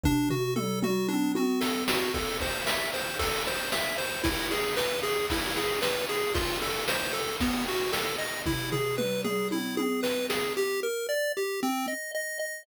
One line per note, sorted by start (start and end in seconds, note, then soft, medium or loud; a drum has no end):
0.04 0.29 D4 loud
0.04 kick loud
0.04 floor tom medium
0.30 0.54 F#4 medium
0.30 floor tom medium
0.56 0.80 A4 medium
0.56 mid tom loud
0.82 1.07 F#4 medium
0.82 mid tom loud
1.08 1.32 D4 medium
1.08 high tom medium
1.35 1.60 F#4 medium
1.35 high tom loud
1.61 1.84 A4 medium
1.61 snare loud
1.88 2.12 F#4 medium
1.88 snare loud
2.14 2.38 A4 medium
2.14 kick medium
2.14 ride medium
2.40 2.65 C5 medium
2.40 kick medium
2.40 ride medium
2.66 2.90 E5 medium
2.66 snare medium
2.93 3.17 C5 medium
2.93 ride medium
3.19 3.43 A4 medium
3.19 kick medium
3.19 ride medium
3.46 3.71 C5 medium
3.46 ride medium
3.72 3.96 E5 medium
3.72 snare medium
3.98 4.22 C5 medium
3.98 ride medium
4.23 4.47 E4 medium
4.23 kick medium
4.23 ride medium
4.51 4.75 G#4 medium
4.51 ride medium
4.76 5.00 B4 medium
4.76 snare medium
5.03 5.27 G#4 medium
5.03 ride medium
5.30 5.55 E4 medium
5.30 kick medium
5.30 ride medium
5.56 5.80 G#4 medium
5.56 ride medium
5.82 6.05 B4 medium
5.82 snare medium
6.09 6.33 G#4 medium
6.09 ride medium
6.34 6.58 F4 medium
6.34 kick medium
6.34 ride medium
6.62 6.85 A4 medium
6.62 ride medium
6.88 7.12 C5 medium
6.88 snare medium
7.13 7.37 A4 medium
7.13 ride medium
7.40 7.65 B3 medium
7.40 kick medium
7.40 ride medium
7.67 7.92 F#4 medium
7.67 ride medium
7.92 8.16 A4 medium
7.92 snare medium
8.18 8.42 D#5 medium
8.18 ride medium
8.46 8.70 E4 medium
8.46 kick medium
8.46 floor tom medium
8.72 8.96 G#4 medium
8.72 floor tom medium
8.98 9.21 B4 medium
8.98 mid tom medium
9.24 9.48 G#4 medium
9.24 mid tom medium
9.51 9.76 E4 medium
9.51 high tom medium
9.77 10.01 G#4 medium
9.77 high tom medium
10.03 10.26 B4 medium
10.03 snare medium
10.29 10.53 G#4 medium
10.29 snare medium
10.57 10.80 G4 medium
10.83 11.07 A#4 medium
11.09 11.32 D5 medium
11.37 11.60 G4 medium
11.63 11.86 C4 medium
11.88 12.11 D#5 medium
12.15 12.38 D#5 medium
12.39 12.63 D#5 medium